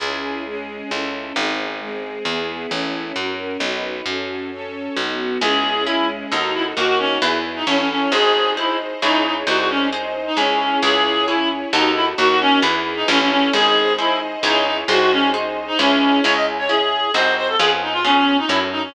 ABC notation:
X:1
M:3/4
L:1/16
Q:1/4=133
K:C#m
V:1 name="Clarinet"
z12 | z12 | z12 | z12 |
G4 E2 z2 D2 E z | F F C2 z3 D C C C2 | G4 E2 z2 D2 D z | F F C2 z3 D C4 |
G4 E2 z2 D2 E z | F F C2 z3 D C C C2 | G4 E2 z2 D2 D z | F F C2 z3 D C4 |
c d z c G4 ^B2 B A | G z D ^E C3 D =E z D C |]
V:2 name="Orchestral Harp"
z12 | z12 | z12 | z12 |
[CEG]4 [CEG]4 [DFA]4 | [DF^A]4 [EGB]4 [E=Ac]4 | [DG^B]4 [DGB]4 [EGc]4 | [DG^B]4 [DGB]4 [EGc]4 |
[EGc]4 [EGc]4 [DFA]4 | [DF^A]4 [EGB]4 [E=Ac]4 | [DG^B]4 [DGB]4 [EGc]4 | [DG^B]4 [DGB]4 [EGc]4 |
[CEG]4 [CEG]4 [^B,DFG]4 | [B,C^EG]4 [B,CEG]4 [CFA]4 |]
V:3 name="Electric Bass (finger)" clef=bass
C,,8 C,,4 | G,,,8 E,,4 | A,,,4 F,,4 B,,,4 | F,,8 B,,,4 |
C,,8 D,,4 | D,,4 E,,4 A,,,4 | G,,,8 C,,4 | ^B,,,8 C,,4 |
C,,8 D,,4 | D,,4 E,,4 A,,,4 | G,,,8 C,,4 | ^B,,,8 C,,4 |
C,,8 ^B,,,4 | ^E,,8 F,,4 |]
V:4 name="String Ensemble 1"
[CEG]4 [G,CG]4 [CEA]4 | [^B,DG]4 [G,B,G]4 [=B,EG]4 | [CEA]4 [CF^A]4 [DFB]4 | [CFA]4 [CAc]4 [B,DF]4 |
[CEG]4 [G,CG]4 [DFA]4 | [DF^A]4 [EGB]4 [E=Ac]4 | [DG^B]4 [DBd]4 [EGc]4 | [DG^B]4 [DBd]4 [EGc]4 |
[EGc]4 [CEc]4 [DFA]4 | [DF^A]4 [EGB]4 [E=Ac]4 | [DG^B]4 [DBd]4 [EGc]4 | [DG^B]4 [DBd]4 [EGc]4 |
z12 | z12 |]